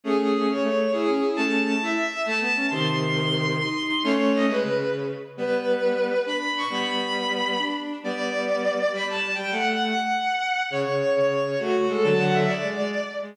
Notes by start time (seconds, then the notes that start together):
0.04 A3 C#4 G#4
0.33 G#4
0.48 C#4 C#5
0.63 A3
0.92 E4 G#4
1.07 C#4
1.22 E4
1.36 A3 C#4 A5
1.66 A5
1.81 E4 E5
2.24 A3 A5
2.40 B3
2.56 C#4
2.70 C3 D#3 C6
3.02 C6
3.15 C6
3.59 D#4 C6
3.88 D#4
4.03 A3 C#4 C#5
4.34 D#5
4.48 G#3 B4
4.63 C#3
5.37 G3 B3 B4
6.26 D4 B5
6.57 C#6
6.70 G3 B3 B5
6.85 B5
7.58 D4
8.03 G3 B3 D5
8.92 G3 B5
9.08 A5
9.35 G3 G5
9.51 A3 F#5
9.82 F#5
10.70 C#3 C#5
10.85 C#3
11.15 C#3 C#5
11.58 A3 F#4
11.89 G#3 A4
12.03 D3 F#3 A5
12.19 F#5
12.33 E5
12.47 D5
12.62 G#3
12.78 G#3
13.22 G#3